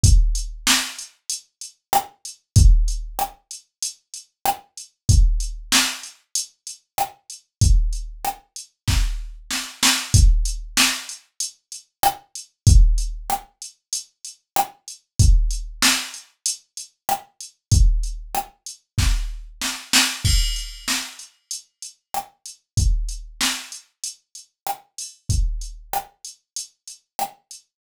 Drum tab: CC |--------|--------|--------|--------|
HH |xx-xxx-x|xx-xxx-x|xx-xxx-x|xx-x----|
SD |--o---r-|--r---r-|--o---r-|--r-o-oo|
BD |o-------|o-------|o-------|o---o---|

CC |--------|--------|--------|--------|
HH |xx-xxx-x|xx-xxx-x|xx-xxx-x|xx-x----|
SD |--o---r-|--r---r-|--o---r-|--r-o-oo|
BD |o-------|o-------|o-------|o---o---|

CC |x-------|--------|--------|
HH |-x-xxx-x|xx-xxx-o|xx-xxx-x|
SD |--o---r-|--o---r-|--r---r-|
BD |o-------|o-------|o-------|